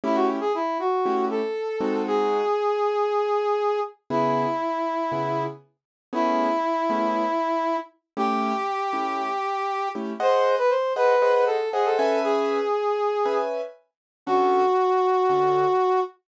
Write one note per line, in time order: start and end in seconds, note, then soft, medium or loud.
0.04 0.39 A3 loud
0.04 0.39 C#4 loud
0.04 0.39 E4 loud
0.04 0.16 E4 medium
0.04 0.39 G4 loud
0.15 0.27 F#4 medium
0.40 0.53 G#4 medium
0.55 0.78 E4 medium
0.79 1.25 F#4 medium
1.06 1.41 A3 medium
1.06 1.41 C#4 medium
1.06 1.41 E4 medium
1.06 1.41 G4 medium
1.31 2.02 A4 medium
1.81 2.42 G#3 loud
1.81 2.42 C4 loud
1.81 2.42 D#4 medium
1.81 2.42 F#4 medium
2.07 3.80 G#4 medium
4.10 4.46 C#3 medium
4.10 4.46 B3 loud
4.10 4.46 E4 medium
4.10 5.43 E4 medium
4.10 4.46 G#4 medium
5.12 5.47 C#3 medium
5.12 5.47 B3 medium
5.12 5.47 E4 medium
5.12 5.47 G#4 medium
6.13 6.48 A3 loud
6.13 6.48 B3 medium
6.13 6.48 C#4 medium
6.13 7.77 E4 medium
6.13 6.48 G#4 loud
6.90 7.25 A3 medium
6.90 7.25 B3 medium
6.90 7.25 C#4 medium
6.90 7.25 G#4 medium
8.17 8.52 A3 loud
8.17 8.52 C#4 medium
8.17 8.52 E4 medium
8.17 8.52 G4 loud
8.17 9.89 G4 medium
8.93 9.28 A3 medium
8.93 9.28 C#4 medium
8.93 9.28 E4 medium
8.93 9.28 G4 medium
9.95 10.13 A3 medium
9.95 10.13 C#4 medium
9.95 10.13 E4 medium
9.95 10.13 G4 medium
10.20 10.56 G#4 medium
10.20 10.56 C5 medium
10.20 10.55 C5 medium
10.20 10.56 D#5 loud
10.20 10.56 F#5 loud
10.58 10.70 B4 medium
10.70 10.93 C5 medium
10.96 11.14 G#4 medium
10.96 11.45 B4 medium
10.96 11.14 C5 medium
10.96 11.14 D#5 medium
10.96 11.14 F#5 medium
11.22 11.58 G#4 medium
11.22 11.58 C5 medium
11.22 11.58 D#5 medium
11.22 11.58 F#5 medium
11.47 11.69 A4 medium
11.73 11.85 G#4 medium
11.73 11.97 G#4 medium
11.73 11.97 C5 medium
11.73 11.97 D#5 medium
11.73 11.97 F#5 medium
11.85 12.19 A4 medium
11.99 12.60 C#4 medium
11.99 12.60 B4 medium
11.99 12.60 E5 loud
11.99 12.60 G#5 loud
12.24 13.38 G#4 medium
13.26 13.61 C#4 medium
13.26 13.61 B4 medium
13.26 13.61 E5 medium
13.26 13.61 G#5 medium
14.26 14.63 D3 loud
14.26 14.63 C#4 loud
14.26 16.00 F#4 medium
14.26 14.63 F#4 loud
14.26 14.63 A4 medium
15.29 15.65 D3 medium
15.29 15.65 C#4 medium
15.29 15.65 F#4 medium
15.29 15.65 A4 medium